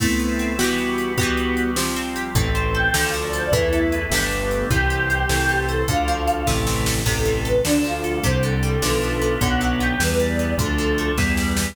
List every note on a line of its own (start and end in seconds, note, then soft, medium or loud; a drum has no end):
0.00 0.53 A3 medium
0.00 0.56 A3 medium
0.00 0.59 A3 medium
0.00 0.53 B3 medium
0.00 0.58 B3 medium
0.00 0.53 C4 medium
0.00 0.59 C4 medium
0.00 0.53 E4 medium
0.00 0.59 E4 medium
0.00 kick medium
0.00 crash medium
0.19 0.57 B3 medium
0.19 closed hi-hat soft
0.39 0.58 C4 medium
0.39 closed hi-hat medium
0.59 1.12 E3 medium
0.59 1.17 E3 medium
0.59 1.17 G3 medium
0.59 1.12 B3 medium
0.59 1.17 B3 medium
0.59 1.12 B3 medium
0.59 1.12 F#4 medium
0.59 1.17 F#4 medium
0.59 1.12 F#4 medium
0.59 1.12 G4 medium
0.59 snare medium
0.64 1.12 E3 medium
0.78 closed hi-hat soft
0.98 closed hi-hat medium
1.18 1.76 E3 medium
1.18 1.71 E3 medium
1.18 1.76 G3 medium
1.18 1.76 B3 medium
1.18 1.71 B3 medium
1.18 1.76 F#4 medium
1.18 1.71 F#4 medium
1.18 1.71 G4 medium
1.18 kick medium
1.18 closed hi-hat medium
1.23 1.71 E3 medium
1.37 closed hi-hat medium
1.57 closed hi-hat medium
1.76 2.29 F3 medium
1.76 2.32 F3 medium
1.76 2.35 F3 medium
1.76 2.35 G3 medium
1.76 2.29 C4 medium
1.76 2.35 C4 medium
1.76 2.29 G4 medium
1.76 snare medium
1.96 2.33 C4 medium
1.96 closed hi-hat soft
2.16 2.34 G4 medium
2.16 closed hi-hat medium
2.35 2.89 A1 loud
2.35 2.88 E3 medium
2.35 2.91 E3 medium
2.35 2.94 E3 medium
2.35 2.94 A3 medium
2.35 2.88 C4 medium
2.35 2.94 C4 medium
2.35 2.88 A4 medium
2.35 kick loud
2.35 closed hi-hat medium
2.55 2.92 C4 medium
2.55 closed hi-hat medium
2.74 2.93 A4 medium
2.74 3.02 G5 loud
2.94 3.49 D2 medium
2.94 3.47 D3 medium
2.94 3.52 D3 medium
2.94 3.50 D3 loud
2.94 3.47 F3 medium
2.94 3.52 F3 medium
2.94 3.52 A3 medium
2.94 3.47 A4 medium
2.94 snare loud
3.04 3.14 F5 medium
3.14 3.51 F3 medium
3.14 closed hi-hat medium
3.23 3.33 D5 medium
3.33 3.52 A4 medium
3.33 3.43 C5 loud
3.33 closed hi-hat medium
3.43 3.53 D5 medium
3.52 4.06 E2 medium
3.52 4.11 E3 medium
3.52 4.09 E3 loud
3.52 4.06 E3 medium
3.52 4.11 A3 medium
3.52 4.11 B3 medium
3.52 4.05 E4 loud
3.52 4.06 A4 medium
3.52 4.06 B4 medium
3.52 kick medium
3.52 closed hi-hat medium
3.73 4.10 A4 medium
3.73 closed hi-hat medium
3.92 4.11 B4 medium
3.92 closed hi-hat medium
4.10 4.65 G1 loud
4.10 4.70 D3 medium
4.10 4.65 D3 medium
4.10 4.70 G3 medium
4.10 4.70 A3 medium
4.10 4.70 B3 medium
4.10 4.65 G4 medium
4.10 4.65 A4 medium
4.10 4.65 A4 loud
4.10 4.65 B4 medium
4.10 snare medium
4.15 4.65 D3 medium
4.15 4.65 G4 loud
4.31 closed hi-hat medium
4.51 closed hi-hat medium
4.70 5.25 C2 loud
4.70 5.28 E3 medium
4.70 5.23 E3 medium
4.70 5.26 E3 medium
4.70 5.28 G3 medium
4.70 5.28 C4 medium
4.70 5.23 G4 medium
4.70 5.65 G4 loud
4.70 5.23 C5 medium
4.70 kick medium
4.70 closed hi-hat medium
4.90 5.27 G4 medium
4.90 closed hi-hat medium
5.10 5.29 C5 medium
5.10 closed hi-hat medium
5.29 5.84 C2 loud
5.29 5.85 E3 medium
5.29 5.82 E3 medium
5.29 5.88 E3 medium
5.29 5.88 A3 medium
5.29 5.88 C4 medium
5.29 5.82 A4 medium
5.29 5.82 C5 medium
5.29 snare medium
5.49 5.86 A4 medium
5.49 closed hi-hat medium
5.68 5.85 A4 medium
5.68 5.87 C5 medium
5.68 closed hi-hat medium
5.88 6.43 D2 loud
5.88 6.44 D3 loud
5.88 6.41 D3 medium
5.88 6.47 D3 medium
5.88 6.41 F3 medium
5.88 6.47 F3 medium
5.88 6.47 A3 medium
5.88 6.41 A4 medium
5.88 6.51 F5 loud
5.88 kick medium
5.88 closed hi-hat medium
6.08 6.45 F3 medium
6.08 closed hi-hat medium
6.27 6.46 A4 medium
6.27 closed hi-hat medium
6.47 7.03 A1 loud
6.47 7.00 C3 medium
6.47 7.03 C3 loud
6.47 7.05 C3 medium
6.47 7.00 E3 medium
6.47 7.05 E3 medium
6.47 7.05 A3 medium
6.47 7.00 A4 medium
6.47 kick medium
6.47 snare medium
6.67 7.04 E3 medium
6.67 snare medium
6.86 7.05 A4 medium
6.86 snare medium
7.05 7.61 A1 loud
7.05 7.64 C3 medium
7.05 7.62 C3 loud
7.05 7.59 C3 medium
7.05 7.64 E3 medium
7.05 7.59 E3 medium
7.05 7.64 A3 medium
7.05 7.42 A4 medium
7.05 7.59 A4 medium
7.05 kick medium
7.05 crash medium
7.25 7.63 E3 medium
7.25 closed hi-hat medium
7.44 7.64 A4 medium
7.44 7.61 B4 loud
7.44 closed hi-hat medium
7.64 8.21 D2 loud
7.64 8.20 D3 medium
7.64 8.18 D3 medium
7.64 8.23 D3 medium
7.64 8.18 F3 medium
7.64 8.23 F3 medium
7.64 8.23 A3 medium
7.64 7.83 D4 loud
7.64 8.18 A4 medium
7.64 snare medium
7.84 8.21 F3 medium
7.84 8.17 F4 medium
7.84 closed hi-hat medium
8.04 8.23 A4 medium
8.04 closed hi-hat medium
8.23 8.79 C2 loud
8.23 8.76 C3 medium
8.23 8.79 C3 medium
8.23 8.82 C3 medium
8.23 8.76 D3 medium
8.23 8.82 D3 medium
8.23 8.76 G3 medium
8.23 8.82 G3 medium
8.23 8.41 C5 loud
8.23 kick medium
8.23 closed hi-hat medium
8.43 8.80 D3 medium
8.43 9.39 A4 medium
8.43 closed hi-hat medium
8.63 8.81 G3 medium
8.63 closed hi-hat medium
8.82 9.37 B1 loud
8.82 9.38 D3 loud
8.82 9.35 D3 medium
8.82 9.40 D3 medium
8.82 9.35 F3 medium
8.82 9.41 F3 medium
8.82 9.35 B3 medium
8.82 9.40 B3 medium
8.82 snare medium
9.02 9.39 F3 medium
9.02 closed hi-hat medium
9.21 9.40 B3 medium
9.21 closed hi-hat medium
9.41 9.95 B1 loud
9.41 9.99 D3 medium
9.41 9.94 D3 medium
9.41 9.97 D3 loud
9.41 9.99 F#3 medium
9.41 9.94 F#3 medium
9.41 9.99 B3 medium
9.41 9.94 B3 medium
9.41 9.73 F#5 loud
9.41 kick medium
9.41 closed hi-hat medium
9.61 9.98 F#3 medium
9.61 closed hi-hat medium
9.80 9.99 B3 medium
9.80 9.98 G5 medium
9.80 closed hi-hat medium
10.00 10.54 E2 loud
10.00 10.58 E3 medium
10.00 10.53 E3 medium
10.00 10.56 E3 loud
10.00 10.58 G3 medium
10.00 10.53 G3 medium
10.00 10.58 B3 medium
10.00 10.53 B3 medium
10.00 10.18 B4 medium
10.00 snare medium
10.20 10.57 G3 medium
10.20 10.56 D5 medium
10.20 closed hi-hat medium
10.39 10.58 B3 medium
10.39 closed hi-hat medium
10.57 11.12 D2 loud
10.57 11.16 D3 medium
10.57 11.12 D3 medium
10.57 11.15 D3 medium
10.57 11.16 F3 medium
10.57 11.12 F3 medium
10.57 11.16 A3 medium
10.57 11.12 A3 medium
10.57 11.09 A4 loud
10.57 kick medium
10.57 closed hi-hat medium
10.78 11.16 F3 medium
10.78 closed hi-hat medium
10.98 11.17 A3 medium
10.98 closed hi-hat medium
11.18 11.72 E2 medium
11.18 11.74 E3 medium
11.18 11.76 E3 medium
11.18 11.71 E3 medium
11.18 11.76 G3 medium
11.18 11.71 G3 medium
11.18 11.76 B3 medium
11.18 11.71 B3 medium
11.18 kick medium
11.18 snare medium
11.37 11.75 G3 medium
11.37 snare medium
11.57 11.76 B3 medium
11.57 snare medium